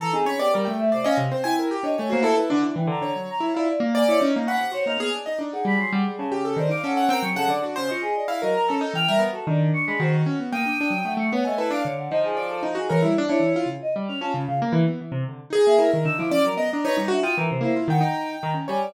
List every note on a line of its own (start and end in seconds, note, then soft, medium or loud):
0.00 0.10 E3 medium
0.00 0.13 A4 loud
0.00 0.12 A#5 loud
0.13 0.26 C4 medium
0.13 0.25 D#4 medium
0.13 0.24 G#4 loud
0.26 0.37 C#4 medium
0.26 0.38 C#5 loud
0.26 0.38 B5 medium
0.39 0.51 B3 medium
0.39 0.52 G4 medium
0.39 0.51 D5 loud
0.54 0.67 G3 loud
0.54 0.65 A#4 medium
0.65 0.91 A3 medium
0.65 0.77 G5 medium
0.79 0.91 E5 loud
0.92 1.06 C3 medium
0.92 1.04 C5 medium
0.92 1.04 D5 medium
1.04 1.17 C#4 loud
1.04 1.16 D#5 medium
1.04 1.17 F5 medium
1.17 1.29 C3 loud
1.31 1.43 C4 medium
1.31 1.43 C5 medium
1.44 1.69 E4 medium
1.44 1.56 G5 medium
1.44 1.56 G#5 loud
1.59 1.71 A#4 medium
1.71 1.83 G4 medium
1.83 1.95 D4 medium
1.83 1.96 C#5 medium
1.83 1.96 D#5 loud
1.97 2.11 A3 loud
1.97 2.10 C#5 medium
1.97 2.09 G#5 medium
2.10 2.25 A#3 loud
2.10 2.21 F#4 medium
2.10 2.22 C5 loud
2.22 2.34 E4 loud
2.22 2.35 A4 loud
2.22 2.36 A4 loud
2.37 2.49 E4 medium
2.37 2.49 B4 medium
2.50 2.63 D3 loud
2.50 2.62 D4 loud
2.63 2.74 E3 medium
2.63 2.75 D4 medium
2.76 2.88 E3 medium
2.76 2.88 G5 medium
2.87 2.99 D3 loud
2.87 3.13 A#5 medium
3.02 3.13 D3 medium
3.02 3.50 C#5 medium
3.16 3.28 F#3 medium
3.30 3.42 A#5 loud
3.40 3.52 E4 medium
3.54 3.68 E4 loud
3.54 3.66 F4 medium
3.54 3.67 D5 medium
3.68 3.80 D5 loud
3.80 4.04 A#3 loud
3.95 4.18 D5 loud
3.95 4.07 G#5 medium
4.08 4.20 E4 medium
4.08 4.20 C#5 loud
4.20 4.33 C#4 loud
4.20 4.44 D#4 medium
4.36 4.48 A#3 medium
4.47 4.59 C#4 medium
4.47 4.72 F#5 medium
4.47 4.59 B5 medium
4.60 4.72 C3 medium
4.72 4.83 F#4 medium
4.72 4.85 C5 medium
4.72 4.85 C#5 loud
4.86 4.98 A#3 medium
4.86 4.99 D#4 medium
4.86 4.99 F6 medium
4.98 5.09 B3 medium
4.98 5.12 G#4 loud
4.98 5.12 F6 medium
5.15 5.27 D4 medium
5.26 5.39 D#4 medium
5.26 5.38 D#5 medium
5.39 5.50 D4 medium
5.39 5.64 D#4 medium
5.53 6.24 G#4 medium
5.53 5.65 F#5 medium
5.65 5.77 G3 medium
5.65 5.79 B5 loud
5.77 5.89 F#3 medium
5.77 5.91 C6 medium
5.92 6.04 G3 loud
5.92 6.04 F#5 medium
6.08 6.20 G3 medium
6.18 6.55 C#3 loud
6.18 6.30 A5 medium
6.32 6.44 G4 medium
6.45 6.57 A4 medium
6.57 6.68 D#3 loud
6.57 6.70 C5 medium
6.57 6.70 D5 medium
6.69 6.81 D#4 medium
6.69 6.83 F5 medium
6.69 6.82 D6 loud
6.84 7.07 C#4 medium
6.84 6.96 A4 medium
6.84 7.09 F#5 medium
6.97 7.09 F#5 medium
7.09 7.21 C4 loud
7.09 7.22 A#4 medium
7.09 7.22 G5 loud
7.22 7.34 F#3 medium
7.22 7.35 G#4 soft
7.22 7.35 C#6 medium
7.36 7.48 C#3 loud
7.36 7.48 A4 loud
7.36 7.48 F#5 loud
7.48 7.60 D3 medium
7.48 7.62 D5 medium
7.62 7.74 D4 medium
7.62 7.75 F#4 medium
7.76 7.89 C#3 medium
7.76 7.88 C5 loud
7.89 8.03 F4 medium
7.89 8.24 D#5 medium
7.89 8.02 C#6 medium
8.02 8.14 G#4 loud
8.16 8.28 D5 medium
8.28 8.40 E4 medium
8.28 8.40 F5 medium
8.42 8.55 F#3 medium
8.42 8.66 A#4 medium
8.42 8.54 D#5 loud
8.55 8.67 A#5 loud
8.68 8.82 C#4 medium
8.68 8.92 A4 medium
8.68 8.80 A4 loud
8.81 8.93 D#4 loud
8.94 9.05 E3 medium
8.94 9.07 G5 medium
8.94 9.07 F6 loud
9.08 9.21 G3 medium
9.08 9.20 A#4 loud
9.08 9.20 E5 loud
9.19 9.31 B3 medium
9.33 9.45 F#4 soft
9.33 9.46 A4 medium
9.47 9.71 D#3 loud
9.47 9.95 D4 medium
9.47 9.59 D5 medium
9.73 9.85 C#6 loud
9.87 10.00 G#3 medium
9.87 9.98 B5 loud
10.00 10.23 D#3 loud
10.00 10.47 F#4 medium
10.00 10.13 C5 medium
10.26 10.38 C#4 medium
10.39 10.51 B3 medium
10.52 10.64 A#3 medium
10.52 11.12 G5 medium
10.52 11.00 D#6 medium
10.66 10.78 D4 medium
10.81 10.92 D4 medium
10.90 11.02 F#3 medium
11.05 11.17 A3 medium
11.05 11.17 F#5 medium
11.17 11.29 A3 medium
11.17 11.30 C#6 medium
11.32 11.44 B3 loud
11.32 11.44 C#5 medium
11.32 11.44 F#5 soft
11.45 11.59 A3 medium
11.45 11.57 D#5 medium
11.45 11.57 G#5 medium
11.58 11.70 E4 medium
11.58 11.69 A4 medium
11.58 11.70 B4 medium
11.71 11.82 D4 loud
11.71 11.83 F5 medium
11.71 11.83 D6 medium
11.84 12.09 D3 medium
11.84 11.96 C#5 medium
11.97 12.09 F#5 medium
12.11 12.71 F3 loud
12.11 12.35 D#4 medium
12.11 12.22 D#5 loud
12.24 12.36 G#4 medium
12.37 12.60 D5 medium
12.37 12.48 D6 medium
12.49 12.61 A4 medium
12.63 12.75 D#4 medium
12.75 12.88 D#4 medium
12.75 12.87 F#4 medium
12.75 12.89 G#4 medium
12.89 13.02 E3 loud
12.89 13.01 A#4 medium
12.89 13.01 C#5 medium
13.02 13.16 G3 medium
13.02 13.14 E4 medium
13.18 13.29 D4 loud
13.29 13.41 D4 medium
13.29 13.65 E4 medium
13.29 13.52 C#5 loud
13.40 13.52 E3 soft
13.56 13.68 F4 medium
13.66 13.78 C#3 medium
13.82 13.94 D#5 loud
13.96 14.08 G3 medium
14.08 14.21 C#4 medium
14.08 14.20 F6 medium
14.21 14.33 C#4 medium
14.21 14.45 F4 medium
14.21 14.32 A5 loud
14.34 14.46 C#3 loud
14.47 14.60 C#3 medium
14.47 14.59 F5 loud
14.62 14.74 A#3 loud
14.72 14.84 E3 loud
14.87 14.99 B3 medium
15.01 15.13 E3 medium
15.12 15.24 C3 loud
15.29 15.41 D3 medium
15.50 15.62 D#4 medium
15.50 15.76 G#4 loud
15.66 15.79 A#3 medium
15.66 15.90 E5 loud
15.79 15.91 E4 medium
15.79 15.90 A#4 medium
15.92 16.05 D#3 medium
15.92 16.04 A#4 medium
16.05 16.17 D3 medium
16.05 16.17 D#4 medium
16.05 16.17 E6 loud
16.18 16.31 F3 medium
16.18 16.30 E4 medium
16.18 16.30 D6 medium
16.31 16.43 C#4 medium
16.31 16.43 D5 loud
16.44 16.56 F#3 medium
16.44 16.57 A#4 medium
16.57 16.69 B3 medium
16.57 16.69 D#5 medium
16.71 16.85 D4 medium
16.71 16.83 D#5 soft
16.71 16.84 A#5 medium
16.84 16.97 D#4 loud
16.84 16.96 B4 medium
16.84 16.96 C#5 loud
16.97 17.10 G3 medium
16.97 17.09 D#4 loud
17.08 17.23 D4 medium
17.08 17.20 F#4 loud
17.08 17.22 E5 medium
17.23 17.35 F4 medium
17.23 17.35 G5 medium
17.23 17.35 D#6 loud
17.37 17.49 E3 loud
17.37 17.48 A#4 medium
17.50 17.63 C3 medium
17.50 17.61 C5 medium
17.61 17.73 A#3 loud
17.61 17.86 E4 medium
17.61 17.75 C5 medium
17.76 17.88 F4 medium
17.88 18.00 D#3 loud
17.88 18.02 F#5 loud
17.88 18.49 G5 medium
18.01 18.36 D#4 medium
18.01 18.26 A#5 medium
18.42 18.55 D#3 loud
18.42 18.54 A#5 medium
18.54 18.66 C#4 medium
18.68 18.93 G3 loud
18.68 18.91 C#5 medium
18.68 18.80 G#5 loud
18.82 18.93 D5 loud